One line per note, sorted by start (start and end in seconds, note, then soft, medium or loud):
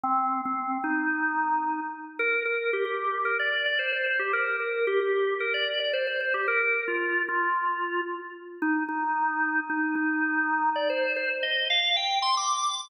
0.03 0.41 C4 loud
0.45 0.78 C4 medium
0.84 1.80 D#4 medium
2.19 2.43 A#4 loud
2.45 2.71 A#4 medium
2.73 2.85 G4 medium
2.85 3.18 G4 medium
3.25 3.38 A#4 medium
3.39 3.65 D5 medium
3.66 3.78 D5 medium
3.79 3.92 C5 medium
3.92 4.05 C5 medium
4.06 4.19 C5 medium
4.19 4.32 G4 medium
4.33 4.56 A#4 loud
4.60 4.86 A#4 medium
4.87 5.00 G4 loud
5.00 5.34 G4 medium
5.40 5.53 A#4 medium
5.54 5.79 D5 medium
5.80 5.93 D5 medium
5.93 6.06 C5 medium
6.07 6.20 C5 medium
6.20 6.33 C5 medium
6.34 6.47 G4 medium
6.48 6.60 A#4 loud
6.60 6.84 A#4 medium
6.88 7.22 F4 medium
7.29 8.01 F4 medium
8.62 8.83 D#4 loud
8.89 9.60 D#4 medium
9.70 9.95 D#4 medium
9.95 10.70 D#4 loud
10.76 10.88 D5 medium
10.90 11.13 C5 medium
11.16 11.29 C5 loud
11.43 11.68 D#5 medium
11.70 11.96 F5 loud
11.97 12.19 G5 medium
12.22 12.35 C6 medium
12.37 12.87 D6 medium